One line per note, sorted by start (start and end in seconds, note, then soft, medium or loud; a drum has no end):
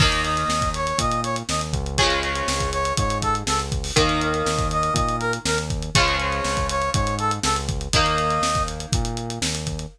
0.00 0.44 D#2 loud
0.00 1.78 D#3 medium
0.00 1.78 A#3 medium
0.00 0.21 D#5 medium
0.00 kick loud
0.00 crash loud
0.12 closed hi-hat loud
0.24 0.69 D#5 medium
0.24 closed hi-hat medium
0.37 closed hi-hat medium
0.48 0.93 D#2 medium
0.48 snare loud
0.62 kick loud
0.62 closed hi-hat medium
0.74 0.99 C#5 medium
0.74 closed hi-hat medium
0.87 closed hi-hat medium
0.98 1.43 A#2 medium
0.98 1.20 D#5 medium
0.98 kick loud
0.98 closed hi-hat loud
1.11 closed hi-hat medium
1.24 1.36 C#5 medium
1.24 closed hi-hat medium
1.36 closed hi-hat medium
1.49 1.72 D#2 medium
1.49 1.61 D#5 medium
1.49 snare loud
1.61 closed hi-hat medium
1.73 2.42 C#2 loud
1.73 kick medium
1.73 closed hi-hat medium
1.86 closed hi-hat medium
1.97 3.77 C#3 medium
1.97 3.77 F3 medium
1.97 2.19 C#5 medium
1.97 kick loud
1.97 closed hi-hat loud
2.02 3.77 G#3 medium
2.10 closed hi-hat medium
2.23 2.70 C#5 medium
2.23 closed hi-hat medium
2.35 closed hi-hat medium
2.48 2.93 C#2 medium
2.48 snare loud
2.60 kick medium
2.60 closed hi-hat medium
2.72 2.93 C#5 medium
2.72 closed hi-hat medium
2.85 closed hi-hat medium
2.97 3.43 G#2 medium
2.97 3.18 C#5 medium
2.97 kick loud
2.97 closed hi-hat loud
3.10 closed hi-hat medium
3.22 3.34 A4 medium
3.22 kick medium
3.22 closed hi-hat loud
3.35 closed hi-hat medium
3.47 3.91 C#2 medium
3.47 3.59 A4 medium
3.47 snare loud
3.59 closed hi-hat medium
3.72 kick loud
3.72 closed hi-hat medium
3.84 open hi-hat medium
3.96 4.43 D#2 loud
3.96 5.74 D#3 medium
3.96 5.74 A#3 medium
3.96 4.21 D#5 medium
3.96 kick loud
3.96 closed hi-hat loud
4.09 closed hi-hat medium
4.21 4.67 D#5 medium
4.21 closed hi-hat loud
4.34 closed hi-hat medium
4.46 4.90 D#2 medium
4.46 snare loud
4.58 kick loud
4.58 closed hi-hat medium
4.71 4.93 D#5 medium
4.71 closed hi-hat medium
4.83 closed hi-hat medium
4.94 5.39 A#2 loud
4.94 5.16 D#5 medium
4.94 kick loud
4.94 closed hi-hat loud
5.08 closed hi-hat medium
5.20 5.32 A#4 medium
5.20 closed hi-hat medium
5.33 closed hi-hat medium
5.45 5.90 D#2 medium
5.45 5.57 A#4 medium
5.45 snare loud
5.58 closed hi-hat medium
5.70 kick loud
5.70 closed hi-hat medium
5.82 closed hi-hat medium
5.95 6.41 C#2 loud
5.95 7.74 C#3 medium
5.95 7.74 F3 medium
5.95 6.16 C#5 loud
5.95 kick loud
5.95 closed hi-hat loud
5.99 7.74 G#3 medium
6.08 closed hi-hat medium
6.20 6.67 C#5 medium
6.20 closed hi-hat medium
6.32 closed hi-hat medium
6.44 6.90 C#2 medium
6.44 snare loud
6.57 kick medium
6.57 closed hi-hat medium
6.69 6.90 C#5 medium
6.69 closed hi-hat loud
6.82 closed hi-hat medium
6.94 7.39 G#2 loud
6.94 7.15 C#5 medium
6.94 kick loud
6.94 closed hi-hat loud
7.07 closed hi-hat medium
7.19 7.31 A4 medium
7.19 closed hi-hat medium
7.31 closed hi-hat medium
7.43 7.88 C#2 loud
7.43 7.55 A4 medium
7.43 snare loud
7.56 closed hi-hat medium
7.69 kick loud
7.69 closed hi-hat medium
7.81 closed hi-hat medium
7.93 8.39 D#2 loud
7.93 9.73 D#3 medium
7.93 9.73 A#3 medium
7.93 8.63 D#5 medium
7.93 kick loud
7.93 closed hi-hat loud
8.06 closed hi-hat medium
8.18 closed hi-hat loud
8.30 closed hi-hat medium
8.41 8.86 D#2 medium
8.41 snare loud
8.55 kick loud
8.55 closed hi-hat medium
8.68 closed hi-hat medium
8.80 closed hi-hat medium
8.92 9.39 A#2 loud
8.92 kick loud
8.92 closed hi-hat loud
9.05 closed hi-hat medium
9.17 closed hi-hat medium
9.30 closed hi-hat medium
9.41 9.86 D#2 medium
9.41 snare loud
9.55 closed hi-hat medium
9.67 kick medium
9.67 closed hi-hat medium
9.79 closed hi-hat medium